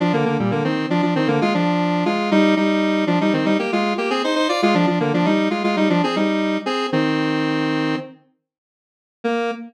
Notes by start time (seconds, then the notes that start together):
0.00 F3 D4
0.13 D3 A#3
0.25 D3 A#3
0.39 A#2 G3
0.51 D3 A#3
0.64 D#3 C4
0.90 F3 D4
1.02 F3 D4
1.16 D#3 C4
1.28 D3 A#3
1.41 G#3 F4
1.54 F3 D4
2.05 G#3 F4
2.31 G3 D#4
2.56 G3 D#4
3.07 F3 D4
3.21 G3 D#4
3.33 D#3 C4
3.45 G3 D#4
3.59 A#3 G4
3.72 G#3 F4
3.98 A#3 G4
4.10 C4 G#4
4.24 D#4 C5
4.35 D#4 C5
4.49 F4 D5
4.62 G#3 F4
4.74 F3 D4
4.87 F3 D4
5.00 D3 A#3
5.14 F3 D4
5.25 G3 D#4
5.50 G#3 F4
5.64 G#3 F4
5.76 G3 D#4
5.90 F3 D4
6.04 C4 G#4
6.16 G3 D#4
6.66 C4 G#4
6.92 D#3 C4
9.24 A#3